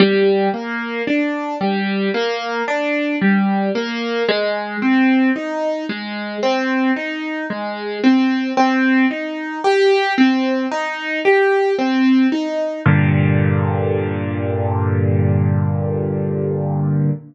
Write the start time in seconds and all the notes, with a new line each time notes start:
0.00 G3
0.54 A#3
1.07 D4
1.61 G3
2.14 A#3
2.68 D4
3.21 G3
3.75 A#3
4.29 G#3
4.82 C4
5.36 D#4
5.89 G#3
6.43 C4
6.96 D#4
7.50 G#3
8.04 C4
8.57 C4
9.11 D#4
9.64 G4
10.18 C4
10.71 D#4
11.25 G4
11.79 C4
12.32 D#4
12.86 G2 A#2 D3